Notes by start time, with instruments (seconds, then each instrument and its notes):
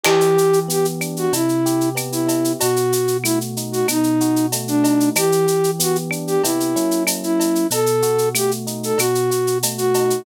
0.03 electric piano 1 E3, flute G4, crash, cowbell, claves
0.21 shaker
0.37 electric piano 1 G4, shaker
0.53 shaker
0.68 electric piano 1 B3, flute G4, shaker
0.85 shaker
1.01 electric piano 1 D4, claves, shaker
1.16 flute F#4, shaker
1.32 electric piano 1 C3, flute E4, cowbell, shaker
1.49 shaker
1.66 electric piano 1 G4, shaker
1.81 shaker
1.95 electric piano 1 B3, cowbell, claves, shaker
2.12 flute E4, shaker
2.27 electric piano 1 E4, cowbell, shaker
2.44 shaker
2.59 electric piano 1 B2, flute F#4, cowbell, shaker
2.76 shaker
2.92 electric piano 1 F#4, shaker
3.08 shaker
3.24 electric piano 1 A3, flute E4, claves, shaker
3.41 shaker
3.57 electric piano 1 D#4, shaker
3.72 flute F#4, shaker
3.88 electric piano 1 B2, flute D#4, cowbell, claves, shaker
4.03 shaker
4.20 electric piano 1 F#4, shaker
4.36 shaker
4.52 electric piano 1 A3, cowbell, shaker
4.68 flute D4, shaker
4.84 electric piano 1 D#4, cowbell, shaker
5.00 shaker
5.15 electric piano 1 E3, flute G4, cowbell, claves, shaker
5.32 shaker
5.47 electric piano 1 G4, shaker
5.64 shaker
5.79 electric piano 1 B3, flute F#4, shaker
5.95 shaker
6.11 electric piano 1 D4, claves, shaker
6.27 flute G4, shaker
6.43 electric piano 1 C3 B3 E4 G4, flute E4, cowbell, shaker
6.60 shaker
6.76 electric piano 1 F#3 A#3 C#4 E4, shaker
6.91 shaker
7.07 cowbell, claves, shaker
7.23 flute E4, shaker
7.40 cowbell, shaker
7.55 shaker
7.70 electric piano 1 B2, flute A4, cowbell, shaker
7.86 shaker
8.02 electric piano 1 F#4, shaker
8.18 shaker
8.34 electric piano 1 A3, flute G4, claves, shaker
8.51 shaker
8.66 electric piano 1 D#4, shaker
8.83 flute A4, shaker
8.98 electric piano 1 B2, flute F#4, cowbell, claves, shaker
9.15 shaker
9.30 electric piano 1 F#4, shaker
9.47 shaker
9.63 electric piano 1 A3, cowbell, shaker
9.78 flute F#4, shaker
9.94 electric piano 1 D#4, cowbell, shaker
10.10 shaker